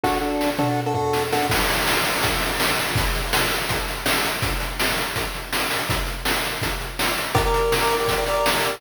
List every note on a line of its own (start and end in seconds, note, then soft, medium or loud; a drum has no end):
0.04 0.18 D4 loud
0.04 0.18 F#4 medium
0.04 0.18 A4 loud
0.04 kick medium
0.04 snare medium
0.21 0.50 D4 medium
0.21 0.50 F#4 medium
0.21 0.50 A4 medium
0.41 snare medium
0.58 0.80 D4 medium
0.58 0.80 F#4 medium
0.58 0.80 A4 medium
0.58 mid tom medium
0.86 0.93 D4 medium
0.86 0.93 F#4 medium
0.86 0.93 A4 medium
0.94 1.23 D4 medium
0.94 1.23 F#4 medium
0.94 1.23 A4 medium
0.94 floor tom medium
1.13 snare medium
1.32 1.47 D4 medium
1.32 1.47 F#4 medium
1.32 1.47 A4 medium
1.32 snare medium
1.50 kick loud
1.50 crash loud
1.69 closed hi-hat medium
1.88 snare loud
2.04 closed hi-hat medium
2.23 kick medium
2.23 closed hi-hat loud
2.42 closed hi-hat medium
2.60 snare loud
2.78 closed hi-hat medium
2.95 kick loud
2.95 closed hi-hat loud
3.15 closed hi-hat medium
3.33 snare loud
3.51 closed hi-hat medium
3.69 kick medium
3.69 closed hi-hat loud
3.88 closed hi-hat medium
4.06 snare loud
4.24 closed hi-hat medium
4.42 kick loud
4.42 closed hi-hat loud
4.60 closed hi-hat medium
4.79 snare loud
4.98 closed hi-hat medium
5.16 kick medium
5.16 closed hi-hat loud
5.34 closed hi-hat medium
5.53 snare loud
5.70 open hi-hat medium
5.89 kick loud
5.89 closed hi-hat loud
6.07 closed hi-hat medium
6.25 snare loud
6.44 closed hi-hat medium
6.62 kick medium
6.62 closed hi-hat loud
6.80 closed hi-hat medium
6.99 snare loud
7.17 closed hi-hat medium
7.35 7.42 G4 loud
7.35 7.42 A#4 loud
7.35 7.42 D5 loud
7.35 kick loud
7.35 closed hi-hat loud
7.45 7.74 G4 loud
7.45 7.74 A#4 loud
7.45 7.74 D5 medium
7.54 closed hi-hat medium
7.72 snare loud
7.81 7.96 G4 medium
7.81 7.96 A#4 loud
7.81 7.96 D5 loud
7.90 closed hi-hat medium
8.00 8.14 G4 loud
8.00 8.14 A#4 medium
8.00 8.14 D5 loud
8.08 kick medium
8.08 closed hi-hat loud
8.17 8.25 G4 medium
8.17 8.25 A#4 loud
8.17 8.25 D5 loud
8.26 8.49 G4 medium
8.26 8.49 A#4 loud
8.26 8.49 D5 loud
8.26 closed hi-hat medium
8.46 snare loud
8.53 8.75 G4 medium
8.53 8.75 A#4 loud
8.53 8.75 D5 loud
8.65 closed hi-hat medium